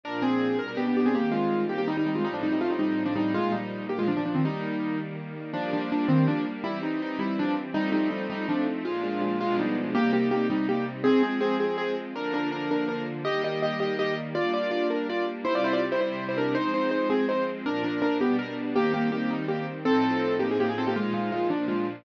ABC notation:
X:1
M:6/8
L:1/16
Q:3/8=109
K:Eb
V:1 name="Acoustic Grand Piano"
[DB]2 [CA]4 B B [=B,G] [B,G] [B,G] [CA] | [B,G]2 [A,F]4 [B,G] [B,G] [G,E] [G,E] [G,E] [A,F] | [G,E] [F,D] [G,E] [G,E] [=A,F] [G,E] [G,E]3 [F,D] [G,E]2 | [A,F]2 [G,E]4 [B,G] [A,F] [F,D] [F,D] [F,D] [E,C] |
[G,E]6 z6 | [F,D]2 [F,D]2 [F,D]2 [E,C]2 [F,D]2 z2 | [G,=E]2 _E2 ^D2 [G,=E]2 [F,=D]2 z2 | [G,E]2 [G,E]2 [G,E]2 [G,E]2 [F,D]2 z2 |
[A,F]2 [A,F]2 [A,F]2 [A,F]2 [G,E]2 z2 | [B,G]2 [B,G]2 [B,G]2 [G,E]2 [B,G]2 z2 | [CA]2 [CA]2 [CA]2 [CA]2 [CA]2 z2 | [DB]2 [DB]2 [DB]2 [DB]2 [DB]2 z2 |
[Ge]2 [Ge]2 [Ge]2 [Ge]2 [Ge]2 z2 | [Fd]2 [Fd]2 [Fd]2 [DB]2 [Fd]2 z2 | [=Ec] [Fd] [Ec] [Fd] z [Ec] [Ec]3 [Ec] [DB]2 | [Ec]2 [Ec]2 [Ec]2 [CA]2 [Ec]2 z2 |
[DB]2 [DB]2 [DB]2 [=B,G]2 _B2 z2 | [B,G]2 [B,G]2 [B,G]2 [G,E]2 [B,G]2 z2 | [C=A]6 [B,G] _A [B,G] ^G [C=A] [B,=G] | [A,F]2 [A,F]2 [A,F]2 [F,D]2 [A,F]2 z2 |]
V:2 name="String Ensemble 1"
[B,,F,D]6 [=B,,G,D]6 | [E,G,C]12 | [=A,,F,CE]12 | [B,,F,E]6 [B,,F,D]6 |
[E,G,B,]12 | [G,B,D]12 | [=E,G,C]12 | [F,=A,CE]12 |
[B,,F,D]6 [=B,,F,A,D]6 | [C,G,E]12 | [F,A,C]12 | [D,F,B,]12 |
[E,G,B,]12 | [G,B,D]12 | [C,G,=E]12 | [F,A,C]12 |
[B,,F,D]6 [=B,,G,D]6 | [E,G,C]12 | [=A,,F,CE]12 | [B,,F,E]6 [B,,F,D]6 |]